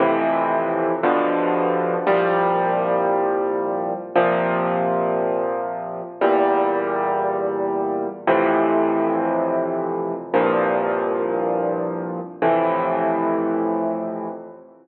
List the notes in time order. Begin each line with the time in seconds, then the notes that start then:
0.00 F2 A2 C3 E3
1.03 G2 B2 D3 F3
2.07 C2 A#2 F3 G3
4.15 A#2 C3 F3
6.21 E2 A#2 G3
8.27 F2 A2 C3 E3
10.34 C2 G2 A#2 F3
12.42 F2 A2 C3 E3